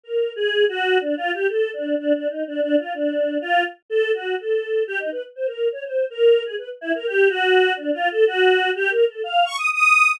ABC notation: X:1
M:3/4
L:1/16
Q:1/4=124
K:none
V:1 name="Choir Aahs"
(3^A4 ^G4 ^F4 (3D2 =F2 =G2 | A2 D2 (3D2 D2 ^D2 (3=D2 D2 F2 | D4 F2 z2 A2 ^F2 | A4 G ^D B z c ^A2 ^c |
c2 ^A3 ^G B z E A =G2 | ^F4 (3D2 =F2 A2 ^F4 | (3G2 ^A2 =A2 f2 ^c' ^d' d'4 |]